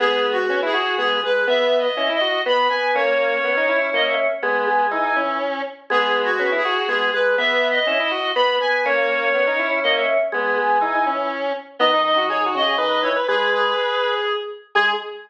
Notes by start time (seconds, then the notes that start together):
0.00 G#3 B3 G#4
0.32 F#4
0.48 B3 C#4
0.62 E4 G#4
0.73 F#4
0.97 G#3 B3 G#4
1.23 G#3 B4
1.47 B3 E5
1.78 D#5
1.97 C#4 E4
2.09 E4
2.14 D#5
2.21 F#4
2.46 B3 B5
2.69 B3 G#5
2.95 A#3 C#4 C#5
3.44 B3
3.57 D#4
3.69 E4
3.93 A#3 D#5
4.05 E5
4.42 G#3 B3 G#5
4.67 G#3
4.91 E3 D#4
5.04 E3
5.16 E3 C#4
5.90 G#3 B3 G#4
6.24 F#4
6.39 B3 C#4
6.52 E4
6.57 G#4
6.65 F#4
6.88 G#3 B3 G#4
7.13 G#3 B4
7.38 B3 E5
7.70 D#5
7.86 C#4 E4
7.99 E4 D#5
8.11 F#4
8.35 B3 B5
8.60 B3 G#5
8.85 A#3 C#4 C#5
9.34 B3
9.47 D#4
9.59 E4
9.84 A#3 D#5
9.95 E5
10.31 G#3 B3 G#5
10.58 G#3
10.81 E3 D#4
10.95 E3
11.06 E3 C#4
11.79 D#3 B3 D#5
11.93 D#4
12.04 D#5
12.16 D#3 F#4
12.29 G#4 C#5
12.46 F#4
12.55 C#3 D#5
12.62 G#4
12.77 D#3 B4 D#5
13.02 E3 C#5
13.16 B4
13.28 G#3 G#4 B4
13.53 G#4
14.75 G#3 G#4